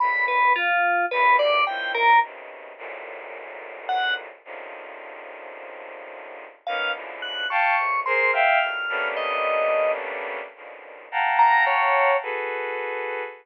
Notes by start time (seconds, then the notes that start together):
0.00 G2 A2 A#2 B2 B5
0.28 B4
0.56 F4
1.11 E2 F#2 G2 B4
1.39 D5
1.67 A#3 C4 C#4 D#4 E4 F4 G5
1.94 A#4
2.22 B2 C3 C#3 D#3
2.78 F#2 G#2 A2 A#2
3.89 F#5
4.45 C3 C#3 D3 D#3 F3
6.67 A#3 B3 C#4 D#4 F5
6.94 B2 C#3 D3 E3 F3
7.22 F#6
7.50 F5 G5 A5 C#6
7.78 A2 A#2 C3
8.06 G#4 A#4 C5 C6
8.33 E5 F5 G5 F6
8.61 D#3 E3 F#3 G3 A3
8.89 G3 A3 A#3 B3 C#4 D4
9.17 D#5
10.56 A#2 B2 C#3 D3 D#3 F3
11.12 F5 F#5 G5 A5 A#5
11.39 A#5
11.66 C#5
12.22 F#4 G#4 A4 B4